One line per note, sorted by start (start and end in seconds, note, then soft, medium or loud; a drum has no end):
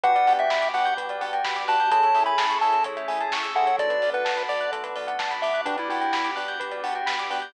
0.04 0.24 G1 medium
0.04 1.89 B3 medium
0.04 0.12 B3 loud
0.04 1.89 D4 medium
0.04 0.12 D4 loud
0.04 1.89 F#4 medium
0.04 0.12 F#4 loud
0.04 1.89 G4 medium
0.04 0.12 G4 loud
0.04 0.14 B4 loud
0.04 0.33 F#5 medium
0.04 kick loud
0.04 closed hi-hat loud
0.15 0.26 D5 medium
0.15 closed hi-hat medium
0.27 0.47 G1 medium
0.27 0.44 B3 loud
0.27 0.44 D4 medium
0.27 0.44 F#4 medium
0.27 0.44 G4 loud
0.27 0.38 F#5 medium
0.27 open hi-hat medium
0.39 0.69 E5 medium
0.39 0.49 G5 medium
0.39 closed hi-hat medium
0.50 0.71 G1 medium
0.50 0.61 B5 medium
0.50 kick loud
0.50 snare loud
0.62 0.72 D6 medium
0.62 closed hi-hat medium
0.74 0.94 G1 medium
0.74 0.91 B3 medium
0.74 0.91 D4 medium
0.74 0.91 F#4 medium
0.74 0.91 G4 medium
0.74 0.94 F#5 medium
0.74 0.85 F#6 medium
0.74 open hi-hat medium
0.85 0.96 G6 medium
0.85 closed hi-hat medium
0.97 1.17 G1 medium
0.97 1.08 B4 medium
0.97 kick loud
0.97 closed hi-hat loud
1.09 1.21 D5 medium
1.09 closed hi-hat medium
1.21 1.41 G1 medium
1.21 1.37 B3 loud
1.21 1.37 D4 medium
1.21 1.37 F#4 medium
1.21 1.37 G4 medium
1.21 1.31 F#5 medium
1.21 open hi-hat medium
1.33 1.44 G5 medium
1.33 closed hi-hat medium
1.44 1.64 G1 medium
1.44 1.55 B5 medium
1.44 kick loud
1.44 snare loud
1.56 1.67 D6 medium
1.56 closed hi-hat medium
1.68 1.88 G1 medium
1.68 1.76 B3 medium
1.68 1.76 D4 loud
1.68 1.76 F#4 loud
1.68 1.76 G4 medium
1.68 1.91 A5 medium
1.68 1.78 F#6 medium
1.68 open hi-hat medium
1.80 1.91 G6 medium
1.80 closed hi-hat medium
1.91 2.11 A1 medium
1.91 1.99 A3 loud
1.91 3.77 A3 medium
1.91 1.99 C#4 loud
1.91 3.77 C#4 medium
1.91 1.99 E4 loud
1.91 3.77 E4 medium
1.91 1.99 G#4 loud
1.91 3.77 G#4 medium
1.91 2.02 A4 medium
1.91 2.24 A5 medium
1.91 kick loud
1.91 closed hi-hat loud
2.03 2.14 C#5 medium
2.03 closed hi-hat medium
2.15 2.35 A1 medium
2.15 2.31 A3 medium
2.15 2.31 C#4 medium
2.15 2.31 E4 medium
2.15 2.31 G#4 medium
2.15 2.25 E5 medium
2.15 open hi-hat medium
2.26 2.37 G#5 medium
2.26 2.58 B5 medium
2.26 closed hi-hat medium
2.38 2.58 A1 medium
2.38 2.48 A5 medium
2.38 kick medium
2.38 snare loud
2.50 2.60 C#6 medium
2.50 closed hi-hat medium
2.61 2.82 A1 medium
2.61 2.78 A3 medium
2.61 2.78 C#4 medium
2.61 2.78 E4 medium
2.61 2.78 G#4 medium
2.61 2.84 A5 medium
2.61 2.72 E6 medium
2.61 open hi-hat medium
2.73 2.84 A4 medium
2.73 closed hi-hat medium
2.84 3.05 A1 medium
2.84 2.96 C#5 medium
2.84 kick medium
2.84 closed hi-hat loud
2.97 3.07 E5 medium
2.97 closed hi-hat medium
3.08 3.28 A1 medium
3.08 3.25 A3 loud
3.08 3.25 C#4 medium
3.08 3.25 E4 medium
3.08 3.25 G#4 medium
3.08 3.18 G#5 medium
3.08 open hi-hat medium
3.21 3.31 A5 medium
3.21 closed hi-hat medium
3.31 3.52 A1 medium
3.31 3.43 C#6 medium
3.31 kick loud
3.31 snare loud
3.43 3.53 E6 medium
3.43 closed hi-hat medium
3.55 3.75 A1 medium
3.55 3.64 A3 medium
3.55 3.64 C#4 medium
3.55 3.64 E4 medium
3.55 3.64 G#4 medium
3.55 3.66 A4 medium
3.55 3.76 F#5 medium
3.67 3.78 C#5 medium
3.67 closed hi-hat medium
3.79 3.99 B1 loud
3.79 5.65 A3 medium
3.79 5.65 B3 medium
3.79 5.65 D4 medium
3.79 5.65 F#4 medium
3.79 3.90 A4 medium
3.79 4.10 D5 medium
3.79 kick loud
3.79 closed hi-hat loud
3.90 4.01 B4 medium
3.90 closed hi-hat medium
4.02 4.22 B1 medium
4.02 4.13 D5 medium
4.02 open hi-hat medium
4.13 4.43 B4 medium
4.13 4.25 F#5 medium
4.13 closed hi-hat medium
4.25 4.46 B1 medium
4.25 4.36 A5 medium
4.25 kick loud
4.25 snare loud
4.37 4.47 B5 medium
4.37 closed hi-hat medium
4.49 4.69 B1 medium
4.49 4.71 D5 medium
4.49 4.59 D6 medium
4.49 open hi-hat medium
4.61 4.71 F#6 medium
4.61 closed hi-hat medium
4.72 4.92 B1 medium
4.72 4.83 A4 medium
4.72 kick loud
4.72 closed hi-hat loud
4.83 4.94 B4 medium
4.83 closed hi-hat medium
4.96 5.16 B1 medium
4.96 5.07 D5 medium
4.96 open hi-hat medium
5.07 5.18 F#5 medium
5.07 closed hi-hat medium
5.19 5.39 B1 medium
5.19 5.30 A5 medium
5.19 kick loud
5.19 snare loud
5.31 5.41 B5 medium
5.31 closed hi-hat medium
5.42 5.63 B1 medium
5.42 5.61 E5 medium
5.42 5.54 D6 medium
5.42 open hi-hat medium
5.54 5.64 F#6 medium
5.54 closed hi-hat medium
5.65 5.86 G1 medium
5.65 5.75 B3 medium
5.65 7.53 B3 medium
5.65 5.77 D4 medium
5.65 5.75 D4 loud
5.65 7.53 D4 medium
5.65 5.75 F#4 loud
5.65 7.53 F#4 medium
5.65 5.75 G4 loud
5.65 7.53 G4 medium
5.65 5.76 B4 medium
5.65 kick loud
5.65 closed hi-hat loud
5.78 5.89 E4 medium
5.78 5.88 D5 medium
5.78 closed hi-hat medium
5.89 6.10 G1 medium
5.89 6.06 B3 medium
5.89 6.06 D4 medium
5.89 6.31 E4 medium
5.89 6.06 F#4 medium
5.89 6.06 G4 loud
5.89 6.01 F#5 medium
5.89 open hi-hat medium
6.01 6.11 G5 medium
6.01 closed hi-hat medium
6.13 6.33 G1 medium
6.13 6.25 B5 medium
6.13 kick loud
6.13 snare loud
6.25 6.35 D6 medium
6.25 closed hi-hat medium
6.36 6.57 G1 medium
6.36 6.53 B3 medium
6.36 6.53 D4 medium
6.36 6.53 F#4 medium
6.36 6.53 G4 medium
6.36 6.46 F#6 medium
6.36 open hi-hat medium
6.48 6.59 G6 medium
6.48 closed hi-hat medium
6.60 6.80 G1 medium
6.60 6.70 B4 medium
6.60 kick loud
6.60 closed hi-hat loud
6.71 6.82 D5 medium
6.71 closed hi-hat medium
6.83 7.03 G1 medium
6.83 7.00 B3 medium
6.83 7.00 D4 medium
6.83 7.00 F#4 medium
6.83 7.00 G4 medium
6.83 6.94 F#5 medium
6.83 open hi-hat loud
6.95 7.06 G5 medium
6.95 closed hi-hat medium
7.06 7.27 G1 medium
7.06 7.17 B5 medium
7.06 kick loud
7.06 snare loud
7.19 7.30 D6 medium
7.19 closed hi-hat medium
7.30 7.50 G1 medium
7.30 7.39 B3 loud
7.30 7.39 D4 medium
7.30 7.39 F#4 medium
7.30 7.39 G4 loud
7.30 7.42 F#6 medium
7.30 open hi-hat loud
7.42 7.53 G6 medium
7.42 closed hi-hat medium